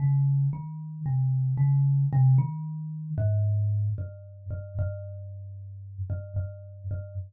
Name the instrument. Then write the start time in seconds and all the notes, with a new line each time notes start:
kalimba
0.00 C#3
0.53 D#3
1.06 C3
1.58 C#3
2.13 C3
2.38 D#3
3.18 G#2
3.98 G2
4.51 G2
4.79 G2
6.10 G2
6.36 G2
6.91 G2